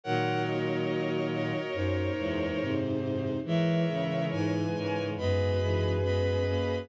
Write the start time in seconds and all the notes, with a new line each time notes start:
0.04 A#2 D#3 F#3 A#4 C#5 F#5
0.46 F#4 D#5
1.32 F#4 D#5
1.73 F#2 D#4 C5
2.19 E2 E3 G#3
2.61 G#2 C3
3.44 E3 G#3 G#4 A#4 C#5 E5
3.90 C#3
4.32 G#2 B4 G#5
4.75 G#2 A#4 C#5
5.17 F#2 G#3 B3 G#4 B4 D#5 B5
5.62 E3 G#3
6.04 G#3 B3 D#5 B5
6.47 A#3 C#4